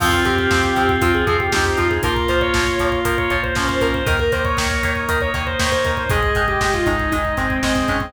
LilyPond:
<<
  \new Staff \with { instrumentName = "Lead 2 (sawtooth)" } { \time 4/4 \key f \minor \tempo 4 = 118 f'16 f'16 g'16 g'4~ g'16 f'16 aes'16 aes'16 g'16 g'16 g'16 f'16 aes'16 | bes'16 bes'16 c''16 des''4~ des''16 bes'16 des''16 des''16 c''16 c''16 c''16 bes'16 c''16 | bes'16 bes'16 c''16 des''4~ des''16 bes'16 des''16 des''16 c''16 c''16 c''16 bes'16 c''16 | aes'8. g'16 g'16 f'16 ees'8 ees'8 c'8 c'16 c'16 des'16 c'16 | }
  \new Staff \with { instrumentName = "Clarinet" } { \time 4/4 \key f \minor c'2. ees'4 | f'2. des'4 | bes'2. des''4 | ees''2. ees''4 | }
  \new Staff \with { instrumentName = "Acoustic Guitar (steel)" } { \time 4/4 \key f \minor <f c'>8 <f c'>8 <f c'>8 <f c'>8 <f c'>8 <f c'>8 <f c'>8 <f c'>8 | <f bes>8 <f bes>8 <f bes>8 <f bes>8 <f bes>8 <f bes>8 <f bes>8 <f bes>8 | <ees bes>8 <ees bes>8 <ees bes>8 <ees bes>8 <ees bes>8 <ees bes>8 <ees bes>8 <ees bes>8 | <ees aes>8 <ees aes>8 <ees aes>8 <ees aes>8 <ees aes>8 <ees aes>8 <ees aes>8 <ees aes>8 | }
  \new Staff \with { instrumentName = "Drawbar Organ" } { \time 4/4 \key f \minor <c' f'>1 | <bes f'>1 | <bes ees'>1 | <aes ees'>1 | }
  \new Staff \with { instrumentName = "Synth Bass 1" } { \clef bass \time 4/4 \key f \minor f,8 f,8 f,8 f,8 f,8 f,8 f,8 f,8 | bes,,8 bes,,8 bes,,8 bes,,8 bes,,8 bes,,8 bes,,8 bes,,8 | ees,8 ees,8 ees,8 ees,8 ees,8 ees,8 ees,8 ees,8 | aes,,8 aes,,8 aes,,8 aes,,8 aes,,8 aes,,8 aes,,8 aes,,8 | }
  \new Staff \with { instrumentName = "Drawbar Organ" } { \time 4/4 \key f \minor <c' f'>1 | <bes f'>1 | <bes ees'>1 | <aes ees'>1 | }
  \new DrumStaff \with { instrumentName = "Drums" } \drummode { \time 4/4 <cymc bd>16 bd16 <hh bd>16 bd16 <bd sn>16 bd16 <hh bd>16 bd16 <hh bd>16 bd16 <hh bd>16 bd16 <bd sn>16 bd16 <hh bd>16 bd16 | <hh bd>16 bd16 <hh bd>16 bd16 <bd sn>16 bd16 <hh bd>16 bd16 <hh bd>16 bd16 <hh bd>16 bd16 <bd sn>16 bd16 <hh bd>16 bd16 | <hh bd>16 bd16 <hh bd>16 bd16 <bd sn>16 bd16 <hh bd>16 bd16 <hh bd>16 bd16 <hh bd>16 bd16 <bd sn>16 bd16 <hh bd>16 bd16 | <hh bd>16 bd16 <hh bd>16 bd16 <bd sn>16 bd16 <hh bd>16 bd16 <hh bd>16 bd16 <hh bd>16 bd16 <bd sn>16 bd16 <hh bd>16 bd16 | }
>>